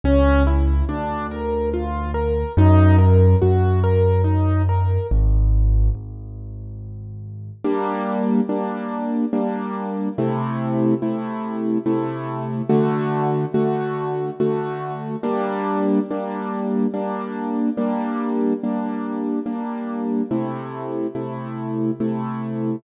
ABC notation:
X:1
M:3/4
L:1/8
Q:1/4=71
K:G#m
V:1 name="Acoustic Grand Piano"
C E =D A ^E A | D A F A D A | z6 | [K:Gm] [G,B,D]2 [G,B,D]2 [G,B,D]2 |
[C,A,=E]2 [C,A,E]2 [C,A,E]2 | [D,A,^F]2 [D,A,F]2 [D,A,F]2 | [G,B,D]2 [G,B,D]2 [G,B,D]2 | [G,B,D]2 [G,B,D]2 [G,B,D]2 |
[C,A,=E]2 [C,A,E]2 [C,A,E]2 |]
V:2 name="Acoustic Grand Piano" clef=bass
C,,2 =D,,4 | F,,2 F,,4 | G,,,2 G,,,4 | [K:Gm] z6 |
z6 | z6 | z6 | z6 |
z6 |]